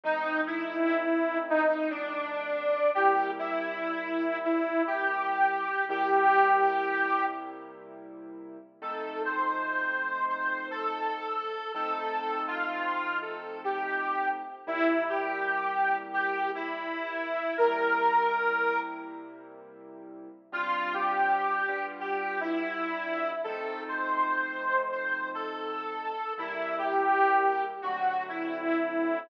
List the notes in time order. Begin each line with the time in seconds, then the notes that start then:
0.04 F3 A3 C4 D#4
0.46 E4
1.49 D#4
1.90 D4
2.95 C3 G3 A#3 E4 G4
3.39 E4
4.45 E4
4.87 G4
5.89 C3 G3 A#3 E4 G4
8.82 F3 A3 C4 D#4 A4
9.25 C5
10.29 C5
10.71 A4
11.74 F3 A3 C4 D#4 A4
12.48 F4
13.22 A4
13.64 G4
14.67 C3 G3 A#3 E4
15.09 G4
16.13 G4
16.55 E4
17.57 C3 G3 A#3 E4 A#4
20.52 G3 C4 D4 F4
20.94 G4
21.68 G3 B3 D4 F4
22.00 G4
22.40 E4
23.44 F3 A3 C4 D#4 A4
23.88 C5
24.92 C5
25.34 A4
26.38 C3 G3 A#3 E4
26.78 G4
27.82 D3 F#3 A3 C4 F#4
28.29 E4